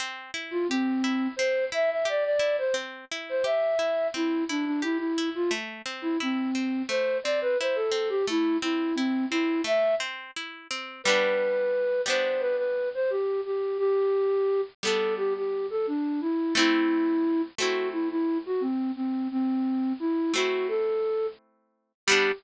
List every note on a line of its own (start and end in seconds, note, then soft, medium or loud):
0.00 0.31 C4 medium
0.34 0.65 E4 medium
0.51 0.67 F4 loud
0.69 1.28 C4 loud
0.69 1.02 G4 medium
1.04 1.35 E4 medium
1.36 1.70 C4 medium
1.36 1.65 C5 loud
1.72 2.03 E4 medium
1.72 1.90 E5 loud
1.91 2.07 E5 medium
2.05 2.36 G4 medium
2.05 2.24 D5 loud
2.25 2.56 D5 loud
2.39 2.70 E4 medium
2.58 2.75 C5 medium
2.74 3.05 C4 medium
3.11 3.43 E4 medium
3.29 3.46 C5 medium
3.44 3.75 G4 medium
3.44 4.07 E5 loud
3.79 4.10 E4 medium
4.14 4.45 C4 medium
4.14 4.44 E4 loud
4.49 4.65 D4 medium
4.49 4.80 E4 medium
4.66 4.82 D4 medium
4.82 4.98 E4 loud
4.82 5.13 G4 medium
4.98 5.30 E4 medium
5.18 5.49 E4 medium
5.35 5.51 F4 loud
5.51 5.82 A3 medium
5.86 6.17 C4 medium
6.02 6.18 E4 medium
6.20 6.82 C4 medium
6.20 6.51 E4 medium
6.55 6.86 C4 medium
6.89 7.20 A3 medium
6.89 7.18 C5 loud
7.24 7.56 C4 medium
7.24 7.40 D5 medium
7.41 7.58 B4 loud
7.60 7.92 E4 medium
7.60 7.77 C5 medium
7.75 8.09 A4 medium
7.92 8.23 C4 medium
8.09 8.26 G4 loud
8.27 8.58 A3 medium
8.27 8.57 E4 loud
8.62 8.93 C4 medium
8.62 8.95 E4 medium
8.95 9.26 C4 loud
8.95 9.29 E4 medium
9.30 9.63 C4 medium
9.30 9.61 E4 loud
9.64 9.95 A3 medium
9.64 9.95 E5 loud
10.00 10.31 C4 medium
10.36 10.68 E4 medium
10.71 11.02 C4 medium
11.04 12.01 G3 medium
11.04 12.01 B3 medium
11.04 12.01 B4 loud
11.09 12.01 D4 medium
12.06 14.60 G3 medium
12.06 14.60 B3 medium
12.06 14.60 D4 medium
12.06 12.41 C5 medium
12.40 12.56 B4 loud
12.57 12.89 B4 medium
12.94 13.11 C5 loud
13.10 13.41 G4 medium
13.45 13.77 G4 medium
13.78 14.61 G4 loud
14.83 16.42 G3 medium
14.83 16.42 B3 medium
14.83 16.42 D4 medium
14.83 15.14 A4 loud
15.17 15.33 G4 loud
15.37 15.67 G4 medium
15.70 15.86 A4 medium
15.87 16.20 D4 medium
16.21 16.54 E4 loud
16.55 17.50 A3 medium
16.55 17.50 C4 loud
16.55 17.42 E4 loud
16.59 17.50 E4 medium
17.58 20.12 A3 medium
17.58 20.12 C4 medium
17.58 20.12 E4 medium
17.58 17.89 F#4 medium
17.92 18.09 E4 medium
18.10 18.38 E4 loud
18.46 18.62 F#4 medium
18.61 18.91 C4 medium
18.96 19.28 C4 medium
19.31 19.93 C4 loud
20.00 20.33 E4 loud
20.34 21.92 A3 medium
20.34 21.92 C4 medium
20.34 21.92 E4 medium
20.34 20.67 F#4 medium
20.68 21.27 A4 loud
22.07 22.32 G3 loud
22.07 22.32 B3 medium
22.07 22.31 G4 loud
22.11 22.32 D4 medium